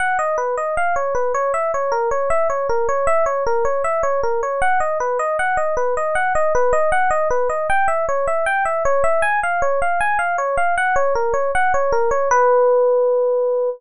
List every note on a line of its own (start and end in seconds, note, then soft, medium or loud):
0.00 0.18 F#5 medium
0.19 0.37 D#5 medium
0.38 0.55 B4 medium
0.58 0.75 D#5 medium
0.77 0.95 F5 medium
0.96 1.14 C#5 medium
1.15 1.32 B4 medium
1.34 1.52 C#5 medium
1.54 1.71 E5 medium
1.74 1.92 C#5 medium
1.92 2.09 A#4 medium
2.11 2.29 C#5 medium
2.30 2.48 E5 medium
2.50 2.67 C#5 medium
2.69 2.87 A#4 medium
2.89 3.06 C#5 medium
3.07 3.25 E5 medium
3.26 3.44 C#5 medium
3.46 3.64 A#4 medium
3.65 3.83 C#5 medium
3.84 4.02 E5 medium
4.03 4.21 C#5 medium
4.23 4.41 A#4 medium
4.43 4.61 C#5 medium
4.62 4.79 F#5 medium
4.80 4.98 D#5 medium
5.00 5.18 B4 medium
5.19 5.37 D#5 medium
5.39 5.57 F#5 medium
5.57 5.75 D#5 medium
5.77 5.95 B4 medium
5.97 6.15 D#5 medium
6.15 6.33 F#5 medium
6.35 6.53 D#5 medium
6.55 6.73 B4 medium
6.73 6.91 D#5 medium
6.92 7.10 F#5 medium
7.11 7.28 D#5 medium
7.30 7.48 B4 medium
7.50 7.67 D#5 medium
7.70 7.87 G5 medium
7.88 8.06 E5 medium
8.09 8.26 C#5 medium
8.27 8.45 E5 medium
8.46 8.64 G5 medium
8.65 8.83 E5 medium
8.85 9.03 C#5 medium
9.04 9.21 E5 medium
9.22 9.40 G#5 medium
9.43 9.61 F5 medium
9.62 9.80 C#5 medium
9.82 10.00 F5 medium
10.00 10.18 G#5 medium
10.19 10.37 F5 medium
10.38 10.56 C#5 medium
10.57 10.75 F5 medium
10.78 10.95 F#5 medium
10.96 11.14 C#5 medium
11.15 11.33 A#4 medium
11.34 11.51 C#5 medium
11.55 11.73 F#5 medium
11.74 11.92 C#5 medium
11.92 12.10 A#4 medium
12.11 12.29 C#5 medium
12.31 13.70 B4 loud